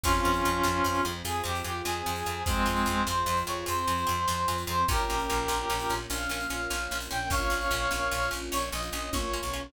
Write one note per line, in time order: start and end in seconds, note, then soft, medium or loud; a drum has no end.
0.03 0.21 F2 loud
0.03 4.84 C4 loud
0.03 0.13 C4 loud
0.03 1.01 C#4 loud
0.03 1.01 F4 loud
0.03 4.84 F4 medium
0.03 0.13 F4 loud
0.03 4.84 G#4 medium
0.03 0.13 G#4 loud
0.03 kick loud
0.03 crash loud
0.25 0.42 F2 medium
0.25 0.33 C4 loud
0.25 0.33 F4 loud
0.25 0.33 G#4 loud
0.34 closed hi-hat loud
0.45 0.62 F2 loud
0.45 0.54 C4 loud
0.45 0.54 F4 loud
0.45 0.54 G#4 medium
0.63 0.82 F2 loud
0.63 0.71 C4 loud
0.63 0.71 F4 loud
0.63 0.71 G#4 loud
0.63 snare loud
0.84 1.01 F2 loud
0.84 0.94 C4 loud
0.84 0.94 F4 loud
0.84 0.94 G#4 loud
0.95 closed hi-hat medium
1.05 1.22 F2 loud
1.05 1.13 C4 loud
1.05 1.13 F4 loud
1.05 1.13 G#4 loud
1.25 1.42 F2 medium
1.25 1.33 C4 loud
1.25 1.33 F4 loud
1.25 1.43 G#4 loud
1.25 1.33 G#4 loud
1.25 closed hi-hat loud
1.44 1.62 F2 loud
1.44 1.52 C4 loud
1.44 1.52 F4 loud
1.44 1.63 G4 loud
1.44 1.52 G#4 loud
1.55 closed hi-hat loud
1.64 1.82 F2 medium
1.64 1.72 C4 loud
1.64 1.72 F4 loud
1.64 1.82 G4 loud
1.64 1.72 G#4 loud
1.85 2.03 F2 loud
1.85 1.93 C4 loud
1.85 1.93 F4 loud
1.85 1.93 G#4 loud
1.85 2.43 G#4 loud
1.85 snare loud
2.06 2.23 F2 loud
2.06 2.14 C4 loud
2.06 2.14 F4 medium
2.06 2.14 G#4 loud
2.16 closed hi-hat loud
2.26 2.43 F2 loud
2.26 2.35 C4 loud
2.26 2.35 F4 loud
2.26 2.35 G#4 loud
2.46 2.64 F2 loud
2.46 3.03 G#3 loud
2.46 3.03 C4 loud
2.46 2.55 C4 loud
2.46 2.55 F4 loud
2.46 2.55 G#4 loud
2.46 kick loud
2.46 closed hi-hat loud
2.66 2.84 F2 loud
2.66 2.74 C4 loud
2.66 2.74 F4 loud
2.66 2.74 G#4 loud
2.76 closed hi-hat loud
2.86 3.04 F2 loud
2.86 2.94 C4 loud
2.86 2.94 F4 loud
2.86 2.94 G#4 loud
3.07 3.24 F2 loud
3.07 3.16 C4 loud
3.07 3.16 F4 loud
3.07 3.16 G#4 loud
3.07 3.39 C5 loud
3.07 snare loud
3.26 3.43 F2 loud
3.26 3.36 C4 loud
3.26 3.36 F4 loud
3.26 3.36 G#4 loud
3.37 closed hi-hat loud
3.47 3.64 F2 medium
3.47 3.55 C4 loud
3.47 3.55 F4 loud
3.47 3.55 G#4 loud
3.47 3.65 C#5 loud
3.66 3.85 F2 loud
3.66 3.74 C4 loud
3.66 3.74 F4 loud
3.66 3.74 G#4 loud
3.66 4.57 C5 loud
3.66 closed hi-hat loud
3.87 4.05 F2 loud
3.87 3.96 C4 medium
3.87 3.96 F4 loud
3.87 3.96 G#4 loud
3.97 closed hi-hat medium
4.07 4.26 F2 loud
4.07 4.15 C4 loud
4.07 4.15 F4 loud
4.07 4.15 G#4 loud
4.28 4.46 F2 loud
4.28 4.36 C4 loud
4.28 4.36 F4 loud
4.28 4.36 G#4 loud
4.28 snare loud
4.48 4.65 F2 loud
4.48 4.56 C4 loud
4.48 4.56 F4 loud
4.48 4.56 G#4 loud
4.58 closed hi-hat loud
4.67 4.85 F2 loud
4.67 4.75 C4 loud
4.67 4.75 F4 loud
4.67 4.75 G#4 loud
4.67 4.86 C5 loud
4.88 5.05 A#1 loud
4.88 9.69 A#3 medium
4.88 4.97 A#3 loud
4.88 9.69 C#4 medium
4.88 4.97 C#4 loud
4.88 9.69 F4 medium
4.88 4.97 F4 loud
4.88 5.92 G4 loud
4.88 5.92 A#4 loud
4.88 kick loud
4.88 closed hi-hat loud
5.10 5.27 A#1 medium
5.10 5.18 A#3 loud
5.10 5.18 C#4 loud
5.10 5.18 F4 loud
5.19 closed hi-hat loud
5.30 5.47 A#1 loud
5.30 5.38 A#3 loud
5.30 5.38 C#4 loud
5.30 5.38 F4 loud
5.48 5.65 A#1 loud
5.48 5.56 A#3 loud
5.48 5.56 C#4 loud
5.48 5.56 F4 loud
5.48 snare loud
5.70 5.87 A#1 loud
5.70 5.78 A#3 loud
5.70 5.78 C#4 loud
5.70 5.78 F4 loud
5.80 closed hi-hat loud
5.89 6.07 A#1 medium
5.89 5.99 A#3 loud
5.89 5.99 C#4 loud
5.89 5.99 F4 loud
6.10 6.27 A#1 loud
6.10 6.18 A#3 medium
6.10 6.18 C#4 loud
6.10 6.18 F4 loud
6.10 6.94 F5 loud
6.10 closed hi-hat loud
6.29 6.46 A#1 loud
6.29 6.39 A#3 loud
6.29 6.39 C#4 loud
6.29 6.39 F4 loud
6.40 closed hi-hat loud
6.50 6.67 A#1 medium
6.50 6.58 A#3 loud
6.50 6.58 C#4 loud
6.50 6.58 F4 loud
6.70 6.88 A#1 loud
6.70 6.78 A#3 loud
6.70 6.78 C#4 loud
6.70 6.78 F4 loud
6.70 snare loud
6.91 7.08 A#1 medium
6.91 7.00 A#3 loud
6.91 7.00 C#4 loud
6.91 7.00 F4 loud
7.01 closed hi-hat loud
7.11 7.29 A#1 medium
7.11 7.19 A#3 loud
7.11 7.19 C#4 loud
7.11 7.19 F4 loud
7.11 7.29 G5 loud
7.30 7.47 A#1 loud
7.30 7.40 A#3 loud
7.30 7.40 C#4 loud
7.30 7.40 F4 loud
7.30 8.30 C#5 loud
7.30 8.30 F5 loud
7.30 kick loud
7.30 closed hi-hat loud
7.50 7.68 A#1 medium
7.50 7.58 A#3 loud
7.50 7.58 C#4 loud
7.50 7.58 F4 loud
7.61 closed hi-hat medium
7.71 7.88 A#1 loud
7.71 7.80 A#3 medium
7.71 7.80 C#4 loud
7.71 7.80 F4 loud
7.91 8.09 A#1 medium
7.91 7.99 A#3 loud
7.91 7.99 C#4 loud
7.91 7.99 F4 loud
7.91 snare loud
8.11 8.29 A#1 loud
8.11 8.20 A#3 loud
8.11 8.20 C#4 loud
8.11 8.20 F4 loud
8.22 closed hi-hat medium
8.31 8.50 A#1 medium
8.31 8.39 A#3 loud
8.31 8.39 C#4 loud
8.31 8.39 F4 loud
8.52 8.70 A#1 loud
8.52 8.60 A#3 loud
8.52 8.60 C#4 loud
8.52 8.60 F4 medium
8.52 8.69 C#5 loud
8.52 closed hi-hat loud
8.72 8.90 A#1 loud
8.72 8.80 A#3 loud
8.72 8.80 C#4 loud
8.72 8.80 F4 loud
8.72 8.89 D#5 loud
8.83 closed hi-hat loud
8.93 9.10 A#1 loud
8.93 9.01 A#3 medium
8.93 9.01 C#4 loud
8.93 9.01 F4 loud
8.93 9.10 D#5 loud
9.13 9.40 A#1 loud
9.13 9.22 A#3 loud
9.13 9.22 C#4 loud
9.13 9.22 F4 loud
9.13 9.62 C#5 loud
9.13 kick loud
9.13 high tom loud
9.34 9.42 A#3 loud
9.34 9.42 C#4 loud
9.34 9.42 F4 loud
9.43 9.70 B1 loud
9.53 9.62 A#3 loud
9.53 9.62 C#4 loud
9.53 9.62 F4 loud